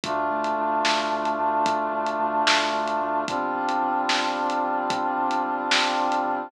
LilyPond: <<
  \new Staff \with { instrumentName = "Brass Section" } { \time 6/8 \key c \major \tempo 4. = 74 <a d' f'>2.~ | <a d' f'>2. | <g c' d' f'>2.~ | <g c' d' f'>2. | }
  \new Staff \with { instrumentName = "Synth Bass 2" } { \clef bass \time 6/8 \key c \major d,8 d,8 d,8 d,8 d,8 d,8 | d,8 d,8 d,8 d,8 d,8 d,8 | g,,8 g,,8 g,,8 g,,8 g,,8 g,,8 | g,,8 g,,8 g,,8 g,,8 g,,8 g,,8 | }
  \new DrumStaff \with { instrumentName = "Drums" } \drummode { \time 6/8 <hh bd>8. hh8. sn8. hh8. | <hh bd>8. hh8. sn8. hh8. | <hh bd>8. hh8. sn8. hh8. | <hh bd>8. hh8. sn8. hh8. | }
>>